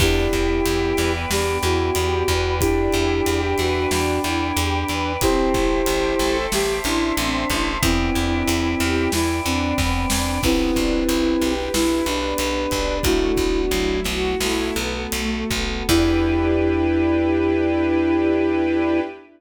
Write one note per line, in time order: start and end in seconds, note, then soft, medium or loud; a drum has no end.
0.00 0.28 E2 medium
0.00 2.30 B3 medium
0.00 0.30 D4 loud
0.00 1.12 E4 medium
0.00 1.12 G4 medium
0.00 1.30 B4 medium
0.00 1.30 D5 medium
0.00 1.30 E5 medium
0.00 1.30 G5 medium
0.00 kick loud
0.00 crash loud
0.33 0.61 E2 medium
0.33 0.63 E4 medium
0.33 kick medium
0.33 ride medium
0.65 0.93 E2 medium
0.65 0.96 G4 medium
0.65 ride loud
0.97 1.26 E2 medium
0.97 1.27 B4 medium
0.97 snare medium
0.97 ride medium
1.29 1.58 E2 medium
1.29 1.58 D4 medium
1.29 1.58 G4 medium
1.29 2.60 B4 medium
1.29 2.60 D5 medium
1.29 2.60 G5 medium
1.29 2.60 B5 medium
1.29 snare loud
1.63 1.91 E2 medium
1.63 1.92 E4 medium
1.63 2.54 F#4 medium
1.63 ride medium
1.95 2.23 E2 medium
1.95 2.25 G4 medium
1.95 ride loud
2.28 2.88 E2 medium
2.28 2.58 B4 medium
2.28 kick medium
2.28 ride medium
2.60 2.90 D4 loud
2.60 5.13 D4 loud
2.60 3.41 E4 medium
2.60 3.41 G4 medium
2.60 3.90 B4 medium
2.60 3.90 D5 medium
2.60 3.90 E5 medium
2.60 3.90 G5 medium
2.60 kick loud
2.60 ride loud
2.92 3.21 E2 medium
2.92 3.22 E4 loud
2.92 ride medium
3.26 3.54 E2 medium
3.26 3.57 G4 loud
3.26 ride loud
3.58 3.87 E2 medium
3.58 3.74 F#4 medium
3.58 3.89 B4 medium
3.58 snare medium
3.58 ride medium
3.75 4.19 F#4 medium
3.90 4.19 E2 medium
3.90 4.20 D4 loud
3.90 5.20 B4 medium
3.90 5.20 D5 medium
3.90 5.20 G5 medium
3.90 5.20 B5 medium
3.90 snare loud
4.24 4.52 E2 medium
4.24 4.53 E4 medium
4.24 ride medium
4.57 4.84 E2 medium
4.57 4.86 G4 medium
4.57 ride loud
4.88 5.17 E2 medium
4.88 5.17 B4 medium
4.88 ride medium
5.21 5.49 A1 medium
5.21 5.52 C4 loud
5.21 6.37 E4 medium
5.21 6.37 G4 medium
5.21 6.50 C5 medium
5.21 6.46 C5 medium
5.21 6.50 E5 medium
5.21 6.50 G5 medium
5.21 6.50 A5 medium
5.21 kick loud
5.21 ride loud
5.54 5.82 A1 medium
5.54 5.83 E4 medium
5.54 kick loud
5.54 ride medium
5.86 6.15 A1 medium
5.86 6.17 G4 loud
5.86 ride loud
6.19 6.47 A1 medium
6.19 6.49 A4 loud
6.19 snare medium
6.19 ride medium
6.52 6.80 A1 medium
6.52 6.81 G4 loud
6.52 6.81 G4 medium
6.52 7.81 C5 medium
6.52 7.57 E5 medium
6.52 7.81 E5 medium
6.52 7.81 A5 medium
6.52 7.81 C6 medium
6.52 snare loud
6.84 7.13 A1 medium
6.84 7.71 D4 medium
6.84 7.14 E4 medium
6.84 ride medium
7.17 7.45 A1 medium
7.17 7.47 C4 medium
7.17 ride loud
7.50 7.78 A1 medium
7.50 7.80 E4 medium
7.50 kick medium
7.50 ride medium
7.81 8.10 E2 medium
7.81 8.12 B3 loud
7.81 9.10 C4 medium
7.81 8.89 E4 medium
7.81 9.10 E4 medium
7.81 9.10 B4 medium
7.81 9.10 D5 medium
7.81 9.10 E5 medium
7.81 9.10 G5 medium
7.81 kick loud
7.81 ride loud
8.15 8.43 E2 medium
8.15 8.45 D4 medium
8.15 ride medium
8.47 8.75 E2 medium
8.47 8.76 E4 medium
8.47 ride loud
8.80 9.08 E2 medium
8.80 9.10 G4 loud
8.80 snare medium
8.80 ride medium
9.12 9.40 E2 medium
9.12 9.42 E4 medium
9.12 9.41 E4 medium
9.12 10.42 B4 medium
9.12 10.42 D5 medium
9.12 10.42 G5 medium
9.12 10.42 B5 medium
9.12 snare loud
9.44 9.73 E2 medium
9.44 10.39 C4 medium
9.44 9.74 D4 loud
9.44 ride medium
9.78 10.06 E2 medium
9.78 10.07 B3 medium
9.78 kick loud
9.78 snare loud
10.10 10.39 E2 medium
10.10 10.41 D4 medium
10.10 snare loud
10.43 10.71 B1 medium
10.43 11.72 B3 medium
10.43 10.74 B3 loud
10.43 11.53 C4 medium
10.43 11.72 D4 medium
10.43 11.72 E4 medium
10.43 11.53 E4 medium
10.43 11.72 G4 medium
10.43 12.97 B4 loud
10.43 kick loud
10.43 crash loud
10.76 11.04 B1 medium
10.76 11.05 D4 medium
10.76 kick medium
10.76 ride medium
11.09 11.36 B1 medium
11.09 11.39 E4 medium
11.09 ride loud
11.41 11.69 B1 medium
11.41 11.71 G4 medium
11.41 snare medium
11.41 ride medium
11.73 12.02 B1 medium
11.73 13.03 B3 medium
11.73 13.05 D4 medium
11.73 12.03 E4 loud
11.73 12.05 E4 medium
11.73 13.05 G4 medium
11.73 13.05 B4 medium
11.73 snare loud
12.06 12.34 B1 medium
12.06 12.35 D4 medium
12.06 13.01 D4 medium
12.06 ride medium
12.38 12.67 B1 medium
12.38 12.68 B3 medium
12.38 ride loud
12.71 12.99 B1 medium
12.71 13.02 D4 loud
12.71 kick medium
12.71 ride medium
13.03 13.32 B1 medium
13.03 14.38 A3 medium
13.03 13.33 A3 loud
13.03 14.38 B3 medium
13.03 13.99 D4 medium
13.03 14.38 E4 medium
13.03 13.61 E4 medium
13.03 14.38 F#4 medium
13.03 13.99 F#4 medium
13.03 kick loud
13.03 ride loud
13.37 13.66 B1 medium
13.37 13.68 B3 medium
13.37 kick loud
13.37 ride medium
13.71 14.00 B1 medium
13.71 14.34 F#3 medium
13.71 14.03 E4 medium
13.71 ride loud
14.04 14.35 B1 medium
14.04 14.37 F#4 medium
14.04 snare medium
14.04 ride medium
14.40 14.71 B1 medium
14.40 15.87 A3 medium
14.40 15.87 B3 medium
14.40 14.74 E4 loud
14.40 14.74 F#4 medium
14.40 15.87 F#4 medium
14.40 15.87 A4 medium
14.40 snare loud
14.75 15.07 B1 medium
14.75 15.08 B3 loud
14.75 ride medium
15.12 15.44 B1 medium
15.12 15.47 A3 medium
15.12 ride loud
15.50 15.83 B1 medium
15.50 15.84 B3 medium
15.50 kick medium
15.50 ride medium
15.88 19.00 E2 loud
15.88 19.02 B3 loud
15.88 19.01 D4 loud
15.88 19.02 D4 loud
15.88 19.00 E4 loud
15.88 19.01 E4 loud
15.88 19.02 E4 medium
15.88 19.01 G4 loud
15.88 19.02 G4 medium
15.88 19.01 B4 loud
15.88 kick loud
15.88 crash loud